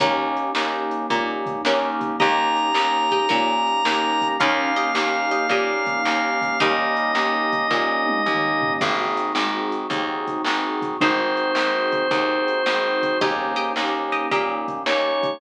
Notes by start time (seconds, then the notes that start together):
0.00 D#2 A#3 C#4 D#4 G4 A#4, kick, closed hi-hat
0.37 closed hi-hat
0.55 D#2 A#3 C#4 D#4 G4, snare
0.91 closed hi-hat
1.10 A#2 A#3 C#4 D#4 G4, kick, closed hi-hat
1.46 kick, closed hi-hat
1.65 D#2 A#3 C#4 D#4 G4 A#4, snare
2.01 kick, closed hi-hat
2.19 D#2 A#3 C#4 D#4 G4 D#5 A#5, kick, closed hi-hat
2.57 closed hi-hat
2.74 D#2 A#3 C#4 D#4 G4, snare
3.11 G4 D#5, kick, closed hi-hat
3.29 A#2 A#3 C#4 D#4 G4 A#4, kick, closed hi-hat
3.67 closed hi-hat
3.85 D#2 A#3 C#4 D#4 G4, snare
4.21 kick, closed hi-hat
4.40 D#2 A#3 C#4 D#4 G4 A#4 F5, kick, closed hi-hat
4.76 G4 D#5, closed hi-hat
4.95 D#2 A#3 C#4 D#4 G4, snare
5.31 G4 D#5, closed hi-hat
5.49 A#2 A#3 C#4 D#4 G4 D#5, kick, closed hi-hat
5.86 kick, closed hi-hat
6.05 D#2 A#3 C#4 D#4 G4, snare
6.42 kick, closed hi-hat
6.60 D#2 G3 A#3 C#4 D#4 G4 D#5, kick, closed hi-hat
6.97 closed hi-hat
7.15 D#2 A#3 C#4 D#4 G4, snare
7.53 kick, closed hi-hat
7.71 A#2 A#3 C#4 D#4 G4, kick, snare
8.07 high tom
8.26 D#2 A#3 C#4 D#4 G4, mid tom
8.61 floor tom
8.81 G#1 A#3 C4 D#4 F#4 G#4, kick, crash
9.17 closed hi-hat
9.35 G#1 C4 D#4 F#4 G#4, snare
9.72 closed hi-hat
9.90 D#2 C4 D#4 F#4 G#4, kick, closed hi-hat
10.27 kick, closed hi-hat
10.44 G#1 C4 D#4 F#4 G#4, snare
10.82 kick, closed hi-hat
11.01 G#1 C4 D#4 F#4 G#4 C5, kick, closed hi-hat
11.37 closed hi-hat
11.55 G#1 C4 D#4 F#4 G#4, snare
11.92 kick, closed hi-hat
12.11 D#2 C4 D#4 F#4 G#4, kick, closed hi-hat
12.48 closed hi-hat
12.66 G#1 C4 D#4 F#4 G#4, snare
13.03 kick, closed hi-hat
13.20 D#2 A#3 C#4 D#4 G4 D#5, kick, closed hi-hat
13.56 G4 D#5, closed hi-hat
13.76 D#2 A#3 C#4 D#4 G4, snare
14.12 G4 D#5, closed hi-hat
14.31 A#2 A#3 C#4 D#4 G4 D#5, kick, closed hi-hat
14.68 kick, closed hi-hat
14.86 D#2 A#3 C#4 D#4 G4 C#5, snare
15.23 kick, closed hi-hat